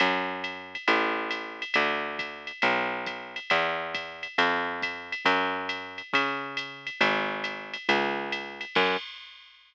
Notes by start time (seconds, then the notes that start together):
0.00 F#2, ride
0.44 hi-hat pedal, ride
0.75 ride
0.88 A1, ride
1.31 hi-hat pedal, ride
1.62 ride
1.74 D2, ride
2.19 kick, hi-hat pedal, ride
2.47 ride
2.62 B1, ride
3.06 kick, hi-hat pedal, ride
3.36 ride
3.50 E2, kick, ride
3.95 kick, hi-hat pedal, ride
4.23 ride
4.38 F2, ride
4.82 kick, hi-hat pedal, ride
5.12 ride
5.25 F#2, kick, ride
5.69 hi-hat pedal, ride
5.98 ride
6.13 C#3, kick, ride
6.57 hi-hat pedal, ride
6.87 ride
7.01 G#1, ride
7.44 hi-hat pedal, ride
7.74 ride
7.89 C#2, ride
8.32 hi-hat pedal, ride
8.61 ride
8.75 F#2, kick, crash